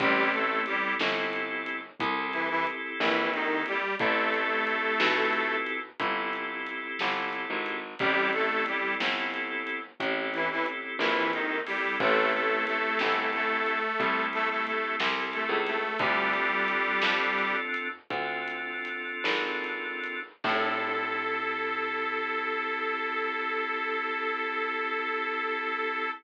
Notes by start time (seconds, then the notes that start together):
0.00 A1 G3 C4 E4 G4 A4, kick, closed hi-hat
0.33 A3 A4, closed hi-hat
0.66 G3 G4, closed hi-hat
0.99 G1, snare
1.33 closed hi-hat
1.66 closed hi-hat
2.00 C2 C4 E4 G4 A4, kick, closed hi-hat
2.33 E3 E4, closed hi-hat
2.50 E3 E4
2.67 closed hi-hat
3.00 A#1 E3 E4, snare
3.33 D#3 D#4, closed hi-hat
3.66 G3 G4, closed hi-hat
3.99 A1 A3 C4 E4 G4 A4, kick, closed hi-hat
4.34 closed hi-hat
4.67 closed hi-hat
5.00 B1, snare
5.33 closed hi-hat
5.67 closed hi-hat
6.00 G1 C4 E4 G4 A4, kick, closed hi-hat
6.33 closed hi-hat
6.67 closed hi-hat
6.99 G1, snare
7.33 closed hi-hat
7.50 G#1
7.66 closed hi-hat
7.99 A1 G3 C4 E4 G4 A4, kick, closed hi-hat
8.33 A3 A4, closed hi-hat
8.66 G3 G4, closed hi-hat
9.00 G1, snare
9.34 closed hi-hat
9.67 closed hi-hat
10.00 A1 C4 E4 G4 A4, kick, closed hi-hat
10.33 E3 E4, closed hi-hat
10.51 E3 E4
10.66 closed hi-hat
10.99 A#1 E3 E4, snare
11.33 D#3 D#4, closed hi-hat
11.67 G3 C4 E4 G4 A4, open hi-hat
12.00 A1 A3 A4, kick, closed hi-hat
12.33 A3 A4, closed hi-hat
12.67 A3 A4, closed hi-hat
12.99 G1 A3 A4, snare
13.33 A3 A4, closed hi-hat
13.66 closed hi-hat
14.00 C2 C4 E4 G4 A4, kick, closed hi-hat
14.33 A3 A4, closed hi-hat
14.50 A3 A4
14.66 A3 A4, closed hi-hat
15.00 C2, snare
15.33 A3 A4, closed hi-hat
15.49 C#2
15.67 A3 A4, closed hi-hat
15.99 D2 G3 C4 D4 F4 G4 A4, kick, closed hi-hat
16.33 closed hi-hat
16.68 closed hi-hat
17.02 F2, snare
17.39 closed hi-hat
17.74 closed hi-hat
18.10 D2 C4 D4 F4 A4, kick, closed hi-hat
18.48 closed hi-hat
18.85 closed hi-hat
19.24 G#1, snare
19.64 closed hi-hat
20.04 closed hi-hat
20.44 A2 C4 E4 G4 A4, kick, crash